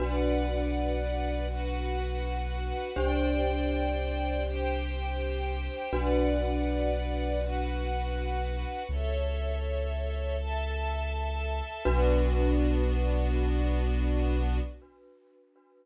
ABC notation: X:1
M:12/8
L:1/8
Q:3/8=81
K:Bm
V:1 name="Glockenspiel"
[DFB]12 | [DG=c]12 | [DFB]12 | z12 |
[DFB]12 |]
V:2 name="Synth Bass 2" clef=bass
B,,,12 | =C,,12 | B,,,12 | C,,12 |
B,,,12 |]
V:3 name="String Ensemble 1"
[Bdf]6 [FBf]6 | [=cdg]6 [Gcg]6 | [Bdf]6 [FBf]6 | [Ace]6 [Aea]6 |
[B,DF]12 |]